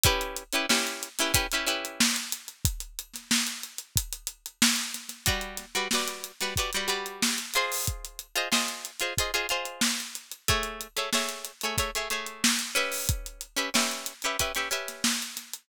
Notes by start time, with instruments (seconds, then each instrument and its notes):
0.03 pizzicato strings C#4 E4 G4 B4, kick, closed hi-hat
0.21 closed hi-hat
0.36 closed hi-hat
0.53 pizzicato strings C#4 E4 G4 B4, closed hi-hat
0.69 pizzicato strings C#4 E4 G4 B4, snare
0.87 closed hi-hat
1.03 closed hi-hat
1.19 pizzicato strings C#4 E4 G4 B4, snare, closed hi-hat
1.34 pizzicato strings C#4 E4 G4 B4, kick, closed hi-hat
1.51 pizzicato strings C#4 E4 G4 B4, closed hi-hat
1.66 pizzicato strings C#4 E4 G4 B4, closed hi-hat
1.85 closed hi-hat
2.00 snare
2.16 closed hi-hat
2.32 closed hi-hat
2.48 closed hi-hat
2.65 kick, closed hi-hat
2.80 closed hi-hat
2.99 closed hi-hat
3.13 snare, closed hi-hat
3.31 snare
3.47 closed hi-hat
3.63 closed hi-hat
3.78 closed hi-hat
3.96 kick, closed hi-hat
4.13 closed hi-hat
4.27 closed hi-hat
4.46 closed hi-hat
4.62 snare
4.76 closed hi-hat
4.94 snare, closed hi-hat
5.09 snare, closed hi-hat
5.26 pizzicato strings G3 F#4 B4 D5, kick, closed hi-hat
5.41 closed hi-hat
5.57 snare, closed hi-hat
5.75 pizzicato strings G3 F#4 B4 D5, closed hi-hat
5.91 pizzicato strings G3 F#4 B4 D5, snare
6.07 closed hi-hat
6.24 closed hi-hat
6.40 pizzicato strings G3 F#4 B4 D5, snare, closed hi-hat
6.56 pizzicato strings G3 F#4 B4 D5, kick, closed hi-hat
6.73 pizzicato strings G3 F#4 B4 D5, closed hi-hat
6.88 pizzicato strings G3 F#4 B4 D5, closed hi-hat
7.06 closed hi-hat
7.22 snare
7.38 closed hi-hat
7.54 pizzicato strings F4 G#4 C5 D#5, closed hi-hat
7.72 open hi-hat
7.87 kick, closed hi-hat
8.05 closed hi-hat
8.19 closed hi-hat
8.35 pizzicato strings F4 G#4 C5 D#5, closed hi-hat
8.52 pizzicato strings F4 G#4 C5 D#5, snare
8.68 closed hi-hat
8.85 closed hi-hat
9.00 pizzicato strings F4 G#4 C5 D#5, closed hi-hat
9.17 pizzicato strings F4 G#4 C5 D#5, kick, closed hi-hat
9.34 pizzicato strings F4 G#4 C5 D#5, closed hi-hat
9.49 pizzicato strings F4 G#4 C5 D#5, closed hi-hat
9.65 closed hi-hat
9.81 snare
10.00 closed hi-hat
10.15 closed hi-hat
10.32 closed hi-hat
10.48 pizzicato strings A3 G#4 C#5 E5, kick, closed hi-hat
10.63 closed hi-hat
10.81 closed hi-hat
10.96 pizzicato strings A3 G#4 C#5 E5, closed hi-hat
11.13 pizzicato strings A3 G#4 C#5 E5, snare
11.29 closed hi-hat
11.45 closed hi-hat
11.61 pizzicato strings A3 G#4 C#5, closed hi-hat
11.65 pizzicato strings E5
11.78 pizzicato strings A3 G#4 C#5 E5, kick, closed hi-hat
11.95 pizzicato strings A3 G#4 C#5 E5, closed hi-hat
12.10 pizzicato strings A3 G#4 C#5 E5, closed hi-hat
12.26 closed hi-hat
12.44 snare
12.59 closed hi-hat
12.75 pizzicato strings C#4 G4 B4 E5, closed hi-hat
12.92 open hi-hat
13.09 kick, closed hi-hat
13.26 closed hi-hat
13.41 closed hi-hat
13.56 pizzicato strings C#4 G4 B4 E5, closed hi-hat
13.74 pizzicato strings C#4 G4 B4 E5, snare
13.91 closed hi-hat
14.06 closed hi-hat
14.22 pizzicato strings C#4 G4 B4 E5, closed hi-hat
14.39 pizzicato strings C#4 G4 B4 E5, kick, closed hi-hat
14.55 pizzicato strings C#4 G4 B4 E5, snare, closed hi-hat
14.71 pizzicato strings C#4 G4 B4 E5, closed hi-hat
14.88 snare, closed hi-hat
15.04 snare
15.22 closed hi-hat
15.37 snare, closed hi-hat
15.53 closed hi-hat